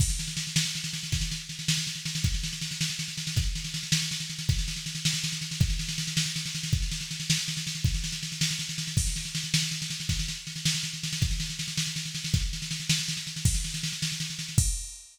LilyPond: \new DrumStaff \drummode { \time 6/8 \tempo 4. = 107 <cymc bd sn>16 sn16 sn16 sn16 sn16 sn16 sn16 sn16 sn16 sn16 sn16 sn16 | <bd sn>16 sn16 sn8 sn16 sn16 sn16 sn16 sn16 sn16 sn16 sn16 | <bd sn>16 sn16 sn16 sn16 sn16 sn16 sn16 sn16 sn16 sn16 sn16 sn16 | <bd sn>8 sn16 sn16 sn16 sn16 sn16 sn16 sn16 sn16 sn16 sn16 |
<bd sn>16 sn16 sn16 sn16 sn16 sn16 sn16 sn16 sn16 sn16 sn16 sn16 | <bd sn>16 sn16 sn16 sn16 sn16 sn16 sn16 sn16 sn16 sn16 sn16 sn16 | <bd sn>16 sn16 sn16 sn16 sn16 sn16 sn16 sn16 sn16 sn16 sn16 sn16 | <bd sn>16 sn16 sn16 sn16 sn16 sn16 sn16 sn16 sn16 sn16 sn16 sn16 |
<cymc bd sn>16 sn16 sn16 sn16 sn16 sn16 sn16 sn16 sn16 sn16 sn16 sn16 | <bd sn>16 sn16 sn8 sn16 sn16 sn16 sn16 sn16 sn16 sn16 sn16 | <bd sn>16 sn16 sn16 sn16 sn16 sn16 sn16 sn16 sn16 sn16 sn16 sn16 | <bd sn>8 sn16 sn16 sn16 sn16 sn16 sn16 sn16 sn16 sn16 sn16 |
<cymc bd sn>16 sn16 sn16 sn16 sn16 sn16 sn16 sn16 sn16 sn16 sn16 sn16 | <cymc bd>4. r4. | }